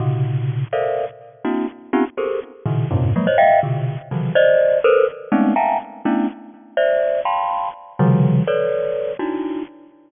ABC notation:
X:1
M:5/8
L:1/16
Q:1/4=124
K:none
V:1 name="Glockenspiel"
[^A,,C,^C,]6 [=A^A=cdef]3 z | z2 [^A,CDE^F]2 z2 [B,C^C^D=FG] z [G^G=A^A=c]2 | z2 [^A,,B,,^C,^D,]2 [F,,G,,^G,,A,,=C,]2 [F,^F,^G,^A,] [c^c^d] [de=f=g]2 | [B,,C,D,]3 z [C,^C,^D,E,^F,]2 [=c=d^d]4 |
[A^ABc]2 z2 [^G,=A,B,C^C^D]2 [ef=g^ga^a]2 z2 | [A,B,^CDE]2 z4 [=cde]4 | [fgabc']4 z2 [C,^C,^D,F,G,]4 | [AB^cd]6 [D^DE^F]4 |]